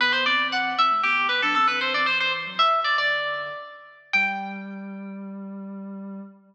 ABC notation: X:1
M:4/4
L:1/16
Q:1/4=116
K:G
V:1 name="Harpsichord"
B c d2 f2 e2 G2 B A A B c d | c c z2 e2 d d5 z4 | g16 |]
V:2 name="Ocarina"
[D,B,]2 [E,C]4 [E,C] [C,A,] [D,B,]2 [D,B,] [F,D] [E,C] [E,C]2 [E,C] | [G,,E,]3 [A,,F,] [E,,C,]2 [E,,C,] [F,,D,]5 z4 | G,16 |]